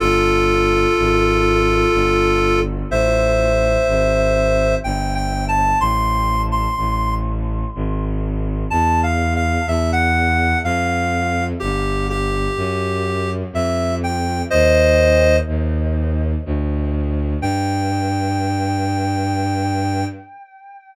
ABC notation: X:1
M:3/4
L:1/16
Q:1/4=62
K:Gmix
V:1 name="Clarinet"
[FA]12 | [ce]8 (3g2 g2 a2 | c'3 c'3 z6 | (3a2 f2 f2 e _g3 f4 |
G2 G6 e2 g2 | [c_e]4 z8 | g12 |]
V:2 name="Violin" clef=bass
G,,,4 _A,,,4 G,,,4 | A,,,4 _A,,,4 G,,,4 | A,,,4 A,,,4 _A,,,4 | E,,4 E,,4 F,,4 |
G,,,4 _G,,4 F,,4 | _E,,4 E,,4 D,,4 | G,,12 |]